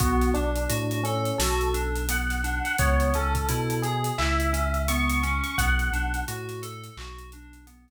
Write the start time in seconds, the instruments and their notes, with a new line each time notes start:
0.00 synth bass 2 B1, electric piano 2 B3, electric piano 1 F#4, kick, closed hi-hat
0.21 snare, closed hi-hat
0.34 synth bass 2 B1, electric piano 1 D4, electric piano 2 D4, closed hi-hat
0.56 closed hi-hat
0.69 synth bass 2 A2, electric piano 2 F#4, closed hi-hat
0.91 closed hi-hat
1.03 electric piano 1 C#4, electric piano 2 A4, closed hi-hat
1.25 closed hi-hat
1.38 synth bass 2 B1, electric piano 2 F#4, electric piano 1 A4, snare
1.61 closed hi-hat
1.74 electric piano 2 D4, closed hi-hat
1.95 closed hi-hat
2.09 electric piano 2 B3, electric piano 1 F#5, closed hi-hat
2.30 snare, closed hi-hat
2.44 electric piano 2 D4, closed hi-hat
2.65 electric piano 1 F#5, closed hi-hat
2.78 synth bass 2 C#2, electric piano 2 B3, electric piano 1 C#5, kick, closed hi-hat
3.00 closed hi-hat
3.14 synth bass 2 C#2, electric piano 2 C#4, electric piano 1 A4, closed hi-hat
3.35 kick, closed hi-hat
3.49 synth bass 2 B2, electric piano 2 E4, closed hi-hat
3.70 closed hi-hat
3.82 electric piano 1 G#4, electric piano 2 G#4, closed hi-hat
4.04 closed hi-hat
4.18 synth bass 2 C#2, electric piano 2 E4, electric piano 1 E5, clap
4.40 closed hi-hat
4.53 electric piano 2 C#4, closed hi-hat
4.74 closed hi-hat
4.88 electric piano 2 B3, electric piano 1 C#6, closed hi-hat
5.10 closed hi-hat
5.23 electric piano 2 C#4, closed hi-hat
5.44 electric piano 1 C#6, closed hi-hat
5.58 synth bass 2 B1, electric piano 2 B3, electric piano 1 F#5, kick, closed hi-hat
5.79 closed hi-hat
5.92 synth bass 2 B1, electric piano 2 D4, closed hi-hat
6.14 closed hi-hat
6.28 synth bass 2 A2, electric piano 2 F#4, closed hi-hat
6.49 snare, closed hi-hat
6.62 electric piano 2 A4, closed hi-hat
6.84 closed hi-hat
6.97 synth bass 2 B1, electric piano 2 F#4, clap
7.18 closed hi-hat
7.32 electric piano 2 D4, closed hi-hat
7.53 closed hi-hat
7.67 electric piano 2 B3, closed hi-hat
7.88 closed hi-hat